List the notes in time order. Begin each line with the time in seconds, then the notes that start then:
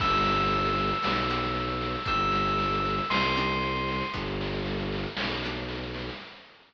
0.00 G1 B3 D4 G4 E6, kick, snare, crash
0.12 snare
0.26 snare
0.39 snare
0.52 snare
0.65 snare
0.78 snare
0.89 snare
1.02 B1 B3 D4 G4, snare
1.15 snare
1.30 B3 D4 G4, snare
1.43 snare
1.55 snare
1.68 snare
1.81 snare
1.95 snare
2.05 G1 C4 D4 D#4 G4 E6, kick, snare
2.20 snare
2.32 snare
2.46 snare
2.58 snare
2.71 snare
2.85 snare
2.98 snare
3.10 C2 C6, snare
3.23 snare
3.36 C4 D4 D#4 G4, snare
3.49 snare
3.62 snare
3.75 snare
3.88 snare
4.00 snare
4.13 G1 B3 D4 G4, kick, snare
4.26 snare
4.41 snare
4.53 snare
4.65 snare
4.78 snare
4.92 snare
5.03 snare
5.17 B1, snare
5.30 snare
5.42 B3 D4 G4, snare
5.55 snare
5.68 snare
5.83 snare
5.94 snare
6.09 snare